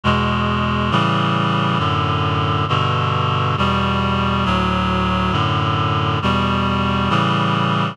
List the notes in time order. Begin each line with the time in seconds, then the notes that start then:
0.03 E2 B2 G#3
0.91 A2 C#3 E3 G3
1.78 F#2 A2 D3
2.68 G2 B2 D3
3.57 E2 B2 G3
4.45 D2 A2 F#3
5.31 F#2 A2 D3
6.22 E2 B2 G3
7.09 A2 C#3 E3 G3